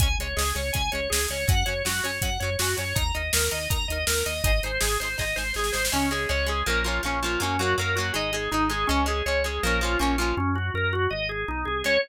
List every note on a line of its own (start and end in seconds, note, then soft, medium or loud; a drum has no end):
0.00 0.16 C#2 medium
0.00 0.08 G#3 medium
0.00 0.08 C#4 medium
0.00 0.15 G#5 medium
0.00 kick medium
0.00 closed hi-hat medium
0.19 0.34 C#2 medium
0.19 0.28 G#3 medium
0.19 0.28 C#4 medium
0.19 0.37 C#5 soft
0.19 closed hi-hat medium
0.36 0.53 C#2 medium
0.36 0.44 G#3 medium
0.36 0.44 C#4 medium
0.36 0.53 G#4 medium
0.36 snare medium
0.55 0.71 C#2 medium
0.55 0.62 G#3 medium
0.55 0.62 C#4 medium
0.55 0.73 C#5 soft
0.55 closed hi-hat medium
0.73 0.90 C#2 medium
0.73 0.82 G#3 medium
0.73 0.82 C#4 medium
0.73 0.90 G#5 medium
0.73 kick medium
0.73 closed hi-hat medium
0.92 1.08 C#2 medium
0.92 1.01 G#3 medium
0.92 1.01 C#4 medium
0.92 1.09 C#5 medium
0.92 closed hi-hat medium
1.10 1.27 C#2 medium
1.10 1.19 G#3 medium
1.10 1.19 C#4 medium
1.10 1.27 G#4 medium
1.10 snare loud
1.29 1.45 C#2 medium
1.29 1.38 G#3 medium
1.29 1.38 C#4 medium
1.29 1.47 C#5 medium
1.29 closed hi-hat medium
1.48 1.64 F#2 medium
1.48 1.55 F#3 medium
1.48 1.55 C#4 medium
1.48 1.66 F#5 medium
1.48 kick loud
1.48 closed hi-hat medium
1.66 1.82 F#2 medium
1.66 1.74 F#3 medium
1.66 1.74 C#4 medium
1.66 1.83 C#5 soft
1.66 closed hi-hat medium
1.85 2.01 F#2 medium
1.85 1.92 F#3 medium
1.85 1.92 C#4 medium
1.85 2.03 F#4 medium
1.85 snare medium
2.03 2.19 F#2 medium
2.03 2.11 F#3 medium
2.03 2.11 C#4 medium
2.03 2.21 C#5 medium
2.03 closed hi-hat medium
2.22 2.38 F#2 medium
2.22 2.30 F#3 medium
2.22 2.30 C#4 medium
2.22 2.39 F#5 medium
2.22 kick medium
2.22 closed hi-hat medium
2.40 2.56 F#2 medium
2.40 2.50 F#3 medium
2.40 2.57 C#5 soft
2.40 closed hi-hat medium
2.44 2.50 C#4 medium
2.59 2.75 F#2 medium
2.59 2.68 F#3 medium
2.59 2.68 C#4 medium
2.59 2.76 F#4 medium
2.59 snare medium
2.77 2.94 F#2 medium
2.77 2.84 F#3 medium
2.77 2.84 C#4 medium
2.77 2.95 C#5 medium
2.77 closed hi-hat medium
2.95 3.12 D#2 medium
2.95 3.03 D#4 medium
2.95 3.03 A#4 medium
2.95 3.12 A#5 medium
2.95 kick medium
2.95 closed hi-hat medium
3.14 3.31 D#2 medium
3.14 3.22 D#4 medium
3.14 3.22 A#4 medium
3.14 3.31 D#5 medium
3.14 closed hi-hat medium
3.33 3.49 D#2 medium
3.33 3.41 D#4 medium
3.33 3.50 A#4 medium
3.33 3.41 A#4 medium
3.33 snare loud
3.51 3.68 D#2 medium
3.51 3.59 D#4 medium
3.51 3.59 A#4 medium
3.51 3.69 D#5 soft
3.51 closed hi-hat medium
3.70 3.86 D#2 medium
3.70 3.77 D#4 medium
3.70 3.77 A#4 medium
3.70 3.87 A#5 medium
3.70 kick medium
3.70 closed hi-hat medium
3.88 4.04 D#2 medium
3.88 3.98 D#4 medium
3.88 4.05 D#5 medium
3.88 closed hi-hat medium
3.92 3.98 A#4 medium
4.07 4.23 D#2 medium
4.07 4.15 D#4 medium
4.07 4.24 A#4 medium
4.07 4.15 A#4 medium
4.07 snare loud
4.26 4.42 D#2 medium
4.26 4.33 D#4 medium
4.26 4.33 A#4 medium
4.26 4.43 D#5 medium
4.26 closed hi-hat medium
4.44 4.60 G#1 medium
4.44 4.51 D#4 medium
4.44 4.51 G#4 medium
4.44 4.51 C5 medium
4.44 4.61 D#5 medium
4.44 kick medium
4.44 closed hi-hat medium
4.63 4.79 G#1 medium
4.63 4.71 D#4 medium
4.63 4.71 G#4 medium
4.63 4.80 C5 medium
4.63 closed hi-hat medium
4.67 4.71 C5 medium
4.80 4.97 G#1 medium
4.80 4.89 D#4 medium
4.80 4.97 G#4 medium
4.80 4.89 G#4 medium
4.80 4.89 C5 medium
4.80 snare medium
5.00 5.16 G#1 medium
5.00 5.09 D#4 medium
5.00 5.09 G#4 medium
5.00 5.17 C5 medium
5.00 closed hi-hat medium
5.05 5.09 C5 medium
5.18 5.34 G#1 medium
5.18 5.25 D#4 medium
5.18 5.25 G#4 medium
5.18 5.25 C5 medium
5.18 5.36 D#5 medium
5.18 kick medium
5.18 snare medium
5.36 5.53 G#1 medium
5.36 5.44 D#4 medium
5.36 5.44 G#4 medium
5.36 5.53 C5 medium
5.36 5.44 C5 medium
5.36 snare medium
5.54 5.71 G#1 medium
5.54 5.63 D#4 medium
5.54 5.73 G#4 medium
5.54 5.63 G#4 medium
5.54 snare medium
5.59 5.63 C5 medium
5.64 snare medium
5.72 5.90 G#1 medium
5.72 5.81 D#4 medium
5.72 5.81 G#4 medium
5.72 5.89 C5 medium
5.72 snare medium
5.77 5.81 C5 medium
5.85 snare medium
5.92 6.26 C#2 loud
5.92 6.09 G#3 loud
5.92 6.10 C#4 medium
5.92 6.09 C#4 loud
6.11 6.28 G#3 medium
6.11 6.28 C#4 medium
6.11 6.29 G#4 medium
6.29 6.63 C#2 medium
6.29 6.46 G#3 medium
6.29 6.46 C#4 medium
6.29 6.46 C#5 medium
6.46 6.64 G#3 medium
6.46 6.64 C#4 medium
6.46 6.66 G#4 medium
6.66 7.00 A#1 medium
6.66 6.83 F3 loud
6.66 6.83 A#3 loud
6.66 6.83 C#4 medium
6.66 6.84 A#4 medium
6.84 7.01 F3 medium
6.84 7.01 A#3 medium
6.84 7.01 C#4 medium
6.84 7.01 F4 medium
7.03 7.37 A#1 medium
7.03 7.20 F3 medium
7.03 7.20 A#3 medium
7.03 7.22 C#4 medium
7.03 7.20 C#4 medium
7.23 7.40 F3 medium
7.23 7.40 A#3 medium
7.23 7.40 C#4 medium
7.23 7.40 F4 medium
7.40 7.74 F#2 medium
7.40 7.57 F#3 loud
7.40 7.57 A#3 medium
7.40 7.59 C#4 medium
7.40 7.57 C#4 loud
7.59 7.76 F#3 medium
7.59 7.76 A#3 medium
7.59 7.76 C#4 medium
7.59 7.77 F#4 medium
7.78 8.11 F#2 medium
7.78 7.95 F#3 medium
7.78 7.95 A#3 medium
7.78 7.95 C#4 medium
7.78 7.96 A#4 medium
7.95 8.14 F#3 medium
7.95 8.14 A#3 medium
7.95 8.12 F#4 medium
8.00 8.14 C#4 medium
8.14 8.48 G#1 loud
8.14 8.31 G#3 loud
8.14 8.31 D#4 loud
8.14 8.33 D#5 medium
8.33 8.50 G#3 loud
8.33 8.50 D#4 medium
8.33 8.51 G#4 medium
8.51 8.85 G#1 medium
8.51 8.69 G#3 medium
8.51 8.68 D#4 medium
8.51 8.69 D#4 loud
8.70 8.87 G#3 loud
8.70 8.87 D#4 medium
8.70 8.87 G#4 medium
8.87 9.22 C#2 loud
8.87 9.05 G#3 loud
8.87 9.04 C#4 medium
8.87 9.06 C#4 loud
9.06 9.23 G#3 loud
9.06 9.23 C#4 medium
9.06 9.25 G#4 medium
9.26 9.59 C#2 medium
9.26 9.43 G#3 medium
9.26 9.43 C#4 medium
9.26 9.43 C#5 medium
9.44 9.61 G#3 medium
9.44 9.61 C#4 medium
9.44 9.62 G#4 medium
9.63 9.96 A#1 loud
9.63 9.80 F3 loud
9.63 9.80 A#3 loud
9.63 9.80 C#4 loud
9.63 9.80 A#4 medium
9.81 9.98 F3 medium
9.81 9.98 A#3 medium
9.81 9.98 C#4 medium
9.81 10.00 F4 medium
9.99 10.33 A#1 medium
9.99 10.16 F3 medium
9.99 10.16 A#3 medium
9.99 10.17 C#4 medium
9.99 10.16 C#4 loud
10.18 10.35 F3 medium
10.18 10.35 A#3 medium
10.18 10.35 C#4 medium
10.18 10.36 F4 medium
10.37 10.70 F#2 medium
10.37 10.54 C#4 medium
10.55 10.72 F#4 medium
10.74 11.07 F#2 medium
10.74 10.92 A#4 medium
10.93 11.10 F#4 medium
11.10 11.44 G#1 loud
11.10 11.27 D#5 medium
11.29 11.46 G#4 medium
11.48 11.65 B1 medium
11.48 11.65 D#4 medium
11.65 11.83 C2 medium
11.65 11.82 G#4 medium
11.84 11.98 C#2 loud
11.84 11.97 G#3 loud
11.84 11.97 C#4 medium
11.84 11.98 C#5 loud